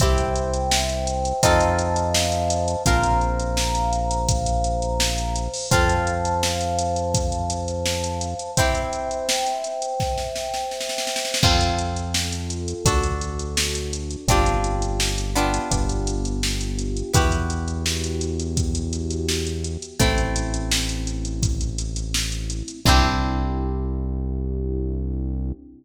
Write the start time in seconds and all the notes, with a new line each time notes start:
0.00 C2 C4 E4 G4 C5 E5 G5, kick, closed hi-hat
0.18 closed hi-hat
0.36 closed hi-hat
0.54 closed hi-hat
0.71 snare
0.89 closed hi-hat
1.07 closed hi-hat
1.25 closed hi-hat
1.43 F2 C4 D#4 F4 A4 C5 D#5 F5 A5, kick, closed hi-hat
1.61 closed hi-hat
1.79 closed hi-hat
1.96 closed hi-hat
2.14 snare
2.32 closed hi-hat
2.50 closed hi-hat
2.68 closed hi-hat
2.86 A#1 C4 F4 A#4 C5 F5 A#5, kick, closed hi-hat
3.03 closed hi-hat
3.21 closed hi-hat
3.40 closed hi-hat
3.57 snare
3.75 closed hi-hat
3.93 closed hi-hat
4.11 closed hi-hat
4.28 kick, closed hi-hat
4.46 closed hi-hat
4.64 closed hi-hat
4.82 closed hi-hat
5.00 snare
5.18 closed hi-hat
5.36 closed hi-hat
5.54 open hi-hat
5.71 F2 C4 F4 A4 C5 F5 A5, kick, closed hi-hat
5.89 closed hi-hat
6.07 closed hi-hat
6.25 closed hi-hat
6.43 snare
6.61 closed hi-hat
6.79 closed hi-hat
6.96 closed hi-hat
7.14 kick, closed hi-hat
7.32 closed hi-hat
7.50 closed hi-hat
7.68 closed hi-hat
7.86 snare
8.04 closed hi-hat
8.21 closed hi-hat
8.39 closed hi-hat
8.57 C4 E4 G4 C5 E5 G5, kick, closed hi-hat
8.75 closed hi-hat
8.93 closed hi-hat
9.11 closed hi-hat
9.29 snare
9.46 closed hi-hat
9.64 closed hi-hat
9.82 closed hi-hat
10.00 kick, snare
10.18 snare
10.36 snare
10.54 snare
10.71 snare
10.81 snare
10.89 snare
10.98 snare
11.07 snare
11.16 snare
11.25 snare
11.34 snare
11.43 F2 C4 F4 A4, kick, crash
11.61 closed hi-hat
11.79 closed hi-hat
11.96 closed hi-hat
12.14 snare
12.32 closed hi-hat
12.50 closed hi-hat
12.68 closed hi-hat
12.85 D2 D4 F#4 A4, kick, closed hi-hat
13.03 closed hi-hat
13.21 closed hi-hat
13.39 closed hi-hat
13.57 snare
13.75 closed hi-hat
13.93 closed hi-hat
14.11 closed hi-hat
14.28 G1 C4 D4 F4 G4, kick, closed hi-hat
14.46 closed hi-hat
14.64 closed hi-hat
14.82 closed hi-hat
15.00 snare
15.18 closed hi-hat
15.35 B3 D4 F4 G4, closed hi-hat
15.54 closed hi-hat
15.71 G1 B3 D4 F4 G4, kick, closed hi-hat
15.89 closed hi-hat
16.07 closed hi-hat
16.25 closed hi-hat
16.43 snare
16.61 closed hi-hat
16.79 closed hi-hat
16.97 closed hi-hat
17.14 E2 B3 E4 F#4 G4, kick, closed hi-hat
17.32 closed hi-hat
17.50 closed hi-hat
17.68 closed hi-hat
17.86 snare
18.04 closed hi-hat
18.21 closed hi-hat
18.40 closed hi-hat
18.57 kick, closed hi-hat
18.75 closed hi-hat
18.93 closed hi-hat
19.11 closed hi-hat
19.29 snare
19.47 closed hi-hat
19.64 closed hi-hat
19.82 closed hi-hat
20.00 A1 A3 C4 E4, kick, closed hi-hat
20.18 closed hi-hat
20.36 closed hi-hat
20.54 closed hi-hat
20.71 snare
20.89 closed hi-hat
21.07 closed hi-hat
21.25 closed hi-hat
21.43 kick, closed hi-hat
21.61 closed hi-hat
21.78 closed hi-hat
21.96 closed hi-hat
22.14 snare
22.32 closed hi-hat
22.50 closed hi-hat
22.68 closed hi-hat
22.85 C2 C4 D4 E4 G4, kick, crash